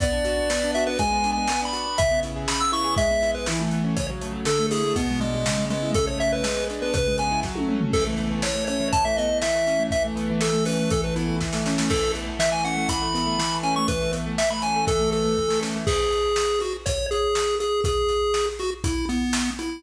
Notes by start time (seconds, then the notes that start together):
0.00 B3 D5, kick, closed hi-hat
0.12 D4
0.25 F#4, closed hi-hat
0.37 D4
0.50 B3, snare
0.63 D4
0.74 F#4 E5, closed hi-hat
0.87 D4 B4
0.99 G#3 G#5, kick, closed hi-hat
1.11 B3
1.24 D4, closed hi-hat
1.32 G#5
1.38 B3
1.48 B3, snare
1.62 D4 B5
1.73 F#4, closed hi-hat
1.86 D4
1.98 C#3 E5, kick, closed hi-hat
2.11 B3
2.23 E4, closed hi-hat
2.36 G#4
2.48 C#3 B5, snare
2.60 B3 E6
2.72 E4 C#6, closed hi-hat
2.84 G#4
2.97 G#3 E5, kick, closed hi-hat
3.11 B3
3.22 E4, closed hi-hat
3.35 B3 B4
3.46 E3 E4, snare
3.60 A3
3.71 B3, closed hi-hat
3.84 C#4
3.97 C#3 C#5, kick, closed hi-hat
4.10 F#3
4.21 A3, closed hi-hat
4.32 F#3
4.45 D3 A4, snare
4.59 A3
4.71 E4 G#4, open hi-hat
4.84 A3
4.96 B2 B3, kick, closed hi-hat
5.10 G#3
5.21 G#3 D4, closed hi-hat
5.34 G#3
5.46 C#3, snare
5.58 G#3
5.70 G#3 B3, closed hi-hat
5.82 E4
5.94 C#3 A4, kick, closed hi-hat
6.06 A3 C#5
6.20 B3 E5, closed hi-hat
6.32 E4 B4
6.43 G#3, snare
6.57 B3
6.70 D4, closed hi-hat
6.82 B3 B4
6.94 C#3 B4, kick, closed hi-hat
7.07 G#3
7.18 B3 G#5, closed hi-hat
7.31 E4
7.43 F#3, kick, snare
7.55 A3, high tom
7.68 C#4, mid tom
7.81 A3, floor tom
7.93 E3 A4, kick, crash
8.06 A3
8.17 B3, closed hi-hat
8.31 A3
8.42 E3 C#5, snare
8.55 A3
8.67 C#4 C#5, closed hi-hat
8.80 E3
8.93 A5, kick, closed hi-hat
9.05 A3 E5
9.17 B3 D#5, closed hi-hat
9.30 A3
9.42 E3 E5, snare
9.54 A3
9.66 C#4, closed hi-hat
9.79 A3
9.91 E3 E5, kick, closed hi-hat
10.05 A3
10.16 B3, closed hi-hat
10.29 E3
10.41 A4, snare
10.53 A3
10.65 C#4 B4, open hi-hat
10.79 A3
10.90 E3 A4, kick, closed hi-hat
11.04 A3 B4
11.16 B3 E4, closed hi-hat
11.28 A3
11.41 E3, kick, snare
11.53 A3, snare
11.66 C#4, snare
11.78 A3, snare
11.90 E3 A4, kick, crash
12.02 A3
12.15 B3, closed hi-hat
12.27 A3
12.39 E3 E5, snare
12.52 A3 G#5
12.65 C#4 F#5, closed hi-hat
12.77 A3
12.89 E3 B5, kick, closed hi-hat
13.02 A3
13.14 B3, closed hi-hat
13.26 A3
13.38 E3, snare
13.51 A3
13.63 C#4 G#5, closed hi-hat
13.76 A3 C#6
13.88 E3 B4, kick, closed hi-hat
14.01 A3
14.12 B3, closed hi-hat
14.26 A3
14.38 E3 E5, snare
14.50 A3 B5
14.62 C#4 G#5, closed hi-hat
14.76 A3
14.86 E3 A4, kick, closed hi-hat
14.99 A3
15.12 B3 A4, closed hi-hat
15.25 A3
15.37 E3, kick
15.48 A3, snare
15.61 C#4, snare
15.76 A3
15.87 G#4, kick, crash
16.12 closed hi-hat
16.36 snare
16.60 F#4, closed hi-hat
16.86 C#5, kick, closed hi-hat
17.11 G#4, closed hi-hat
17.35 snare
17.60 G#4, closed hi-hat
17.84 G#4, kick, closed hi-hat
18.09 closed hi-hat
18.34 snare
18.59 F#4, closed hi-hat
18.84 E4, kick, closed hi-hat
19.09 B3, closed hi-hat
19.33 snare
19.59 E4, closed hi-hat